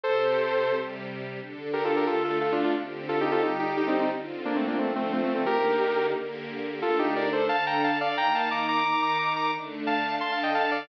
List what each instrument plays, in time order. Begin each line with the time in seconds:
0.03 string ensemble 1 C3 C4 G4, lead 2 (sawtooth) A4 C5
0.73 string ensemble 1 C3 G3 G4
1.40 string ensemble 1 D3 D4 A4
1.73 lead 2 (sawtooth) G4 A#4
1.84 lead 2 (sawtooth) F4 A4
1.96 lead 2 (sawtooth) G4 A#4
2.07 string ensemble 1 D3 A3 A4, lead 2 (sawtooth) F4 A4
2.24 lead 2 (sawtooth) F4 A4
2.41 lead 2 (sawtooth) F4 A4
2.52 lead 2 (sawtooth) D4 F4
2.64 lead 2 (sawtooth) D4 F4
2.76 string ensemble 1 D3 C4 G4
3.09 lead 2 (sawtooth) F4 A4
3.21 lead 2 (sawtooth) D#4 G4
3.32 lead 2 (sawtooth) F4 A4
3.42 string ensemble 1 D3 G3 G4, lead 2 (sawtooth) D#4 G4
3.59 lead 2 (sawtooth) D#4 G4
3.77 lead 2 (sawtooth) D#4 G4
3.87 lead 2 (sawtooth) C4 D#4
3.99 lead 2 (sawtooth) C4 D#4
4.11 string ensemble 1 D3 C4 F4
4.45 lead 2 (sawtooth) A#3 D4
4.56 lead 2 (sawtooth) A3 C4
4.67 lead 2 (sawtooth) A#3 D4
4.78 string ensemble 1 D3 F3 F4, lead 2 (sawtooth) A3 C4
4.96 lead 2 (sawtooth) A3 C4
5.12 lead 2 (sawtooth) A3 C4
5.23 lead 2 (sawtooth) A3 C4
5.35 lead 2 (sawtooth) A3 C4
5.46 string ensemble 1 D3 A#3 D#4 G4, lead 2 (sawtooth) G4 A#4
6.15 string ensemble 1 D3 A#3 G4 A#4
6.82 string ensemble 1 D3 A3 D4, lead 2 (sawtooth) F4 A4
6.99 lead 2 (sawtooth) D#4 G4
7.16 lead 2 (sawtooth) A#4 D5
7.32 lead 2 (sawtooth) A4 C5
7.49 string ensemble 1 D3 D4 A4, lead 2 (sawtooth) F5 A5
7.66 lead 2 (sawtooth) G5 A#5
7.84 lead 2 (sawtooth) F5 A5
8.01 lead 2 (sawtooth) D5 F5
8.16 string ensemble 1 D#3 A#3 D#4, lead 2 (sawtooth) G5 A#5
8.34 lead 2 (sawtooth) F5 A5
8.51 lead 2 (sawtooth) A#5 D6
8.68 lead 2 (sawtooth) A#5 D6
8.84 string ensemble 1 D#3 D#4 A#4, lead 2 (sawtooth) A#5 D6
9.02 lead 2 (sawtooth) A#5 D6
9.19 lead 2 (sawtooth) A#5 D6
9.36 lead 2 (sawtooth) A#5 D6
9.54 string ensemble 1 D3 A3 D4
9.87 lead 2 (sawtooth) F5 A5
10.20 string ensemble 1 D3 D4 A4, lead 2 (sawtooth) A5 C6
10.32 lead 2 (sawtooth) F5 A5
10.43 lead 2 (sawtooth) D#5 G5
10.55 lead 2 (sawtooth) F5 A5
10.71 lead 2 (sawtooth) D5 F5